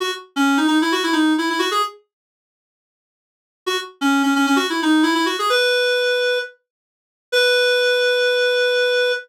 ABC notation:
X:1
M:4/4
L:1/16
Q:1/4=131
K:B
V:1 name="Clarinet"
F z2 C2 D D E F E D2 E E F G | z16 | F z2 C2 C C C F E D2 E E F G | B8 z8 |
B16 |]